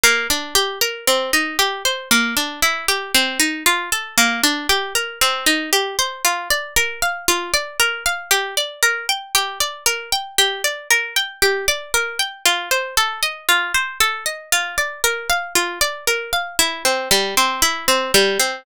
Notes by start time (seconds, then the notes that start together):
0.04 A#3
0.30 D4
0.55 G4
0.81 A#4
1.07 C4
1.33 D#4
1.59 G4
1.85 C5
2.11 A#3
2.37 D4
2.62 E4
2.88 G4
3.14 C4
3.40 D#4
3.66 F4
3.92 A4
4.18 A#3
4.43 D4
4.69 G4
4.95 A#4
5.21 C4
5.46 D#4
5.73 G4
5.99 C5
6.25 F4
6.50 D5
6.76 A#4
7.02 F5
7.28 F4
7.54 D5
7.80 A#4
8.06 F5
8.31 G4
8.57 D5
8.83 A#4
9.09 G5
9.35 G4
9.60 D5
9.86 A#4
10.12 G5
10.38 G4
10.64 D5
10.91 A#4
11.16 G5
11.42 G4
11.68 D5
11.94 A#4
12.19 G5
12.45 F4
12.71 C5
12.97 A4
13.23 D#5
13.49 F4
13.74 C5
14.00 A4
14.26 D#5
14.52 F4
14.78 D5
15.04 A#4
15.30 F5
15.55 F4
15.81 D5
16.07 A#4
16.33 F5
16.59 E4
16.85 C4
17.11 G3
17.37 C4
17.62 E4
17.88 C4
18.14 G3
18.40 C4